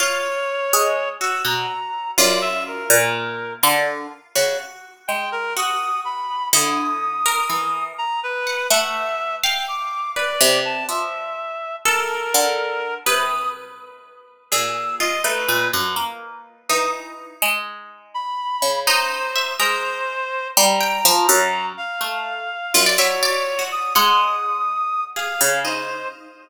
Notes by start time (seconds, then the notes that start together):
0.00 F4 C#5
0.73 G#3
1.21 F#4 E6
1.45 B2 A#5
2.18 F#2 F4 D5
2.42 E5
2.66 A#4
2.90 A#2
3.63 D3 F4
4.35 C#3 F#4
5.08 G#3 G5
5.32 A#4
5.57 F#4 D#6
6.05 B5
6.53 D3 E4 D#6
7.26 A#4
7.49 E3
7.98 A#5
8.23 B4
8.47 F#5
8.70 A3 E5 F#5
9.43 F5 G5
9.68 D6
10.16 B4 D5
10.41 C3
10.65 A5
10.89 F3 E5
11.85 A4 A#4
12.34 D3
13.06 C3 B4 D#6
14.51 A#2 G#4 E6
15.00 F4 D#5
15.24 A3 D#4 B4
15.48 A#2
15.73 F#2
15.96 A#3
16.69 E3 D#4 D#6
17.42 G#3
18.14 B5
18.62 C#3
18.87 D#4 C5
19.36 E5
19.59 G#3 A#4 C5
20.57 G3 A#5
20.81 G5
21.05 F3
21.29 F#2
21.77 F5
22.01 A3
22.74 F#2 F4
22.86 D5
22.98 F#3 C#5 E5
23.23 D5
23.59 F#4
23.71 D#6
23.95 G#3 F#5 D#6
25.16 G#4 F5
25.41 C#3
25.65 D#4 C5